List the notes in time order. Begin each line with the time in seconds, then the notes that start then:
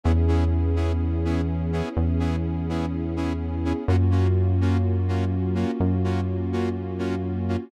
0.04 E2 B3 C#4 E4 G#4
0.28 B3 C#4 E4 G#4
0.76 B3 C#4 E4 G#4
1.25 B3 C#4 E4 G#4
1.72 B3 C#4 E4 G#4
1.97 E2
2.19 B3 C#4 E4 G#4
2.69 B3 C#4 E4 G#4
3.16 B3 C#4 E4 G#4
3.65 B3 C#4 E4 G#4
3.88 F#2 A#3 C#4 F4 F#4
4.11 A#3 C#4 F4 F#4
4.61 A#3 C#4 F4 F#4
5.08 A#3 C#4 F4 F#4
5.55 A#3 C#4 F4 F#4
5.80 F#2
6.04 A#3 C#4 F4 F#4
6.52 A#3 C#4 F4 F#4
6.98 A#3 C#4 F4 F#4
7.48 A#3 C#4 F4 F#4